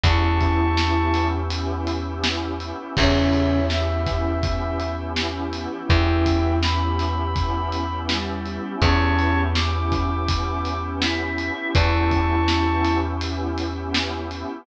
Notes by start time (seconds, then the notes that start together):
0.04 E2 E3 B3 C#4 E4 G4 A5 C#6, kick, closed hi-hat
0.22 B3 C#4 E4 G4
0.41 kick, closed hi-hat
0.77 B3 C#4 E4 G4, snare
0.96 B3 C#4 E4 G4
1.14 snare, closed hi-hat
1.50 B3 C#4 E4 G4, closed hi-hat
1.87 closed hi-hat
2.05 B3 C#4 E4 G4
2.24 snare
2.60 B3 C#4 E4 G4, closed hi-hat
2.78 B3 C#4 E4 G4
2.96 E2 C#3 B3 C#4 E4 G4 C#5 E5, kick, crash
3.15 B3 C#4 E4 G4
3.33 closed hi-hat
3.70 B3 C#4 E4 G4 E5, snare
3.89 B3 C#4 E4 G4
4.07 kick, snare, closed hi-hat
4.43 B3 C#4 E4 G4, kick, closed hi-hat
4.80 closed hi-hat
4.98 B3 C#4 E4 G4
5.16 E3 E4, snare
5.52 B3 C#4 E4 G4, closed hi-hat
5.71 B3 C#4 E4 G4
5.89 E2 E3 B3 C#4 E4 G4 E5 G5, kick
6.08 B3 C#4 E4 G4
6.26 kick, closed hi-hat
6.62 B3 C#4 E4 G4 B5, snare
6.81 B3 C#4 E4 G4
6.99 snare, closed hi-hat
7.36 B3 C#4 E4 G4, kick, closed hi-hat
7.72 closed hi-hat
7.91 B3 C#4 E4 G4
8.09 G3 G4, snare
8.46 B3 C#4 E4 G4, closed hi-hat
8.64 B3 C#4 E4 G4
8.82 E2 B3 C#4 E4 G4 C#5 A5 C#6, kick, closed hi-hat
9.01 B3 C#4 E4 G4
9.19 closed hi-hat
9.55 B3 C#4 E4 G4 D6, snare
9.74 B3 C#4 E4 G4
9.92 kick, snare, closed hi-hat
10.29 B3 C#4 E4 G4, kick, closed hi-hat
10.65 closed hi-hat
10.83 B3 C#4 E4 G4
11.02 E4 E5, snare
11.38 B3 C#4 E4 G4, closed hi-hat
11.57 B3 C#4 E4 G4
11.75 E2 E3 B3 C#4 E4 G4 A5 C#6, kick, closed hi-hat
11.93 B3 C#4 E4 G4
12.11 kick, closed hi-hat
12.48 B3 C#4 E4 G4, snare
12.66 B3 C#4 E4 G4
12.85 snare, closed hi-hat
13.21 B3 C#4 E4 G4, closed hi-hat
13.58 closed hi-hat
13.77 B3 C#4 E4 G4
13.94 snare
14.31 B3 C#4 E4 G4, closed hi-hat
14.49 B3 C#4 E4 G4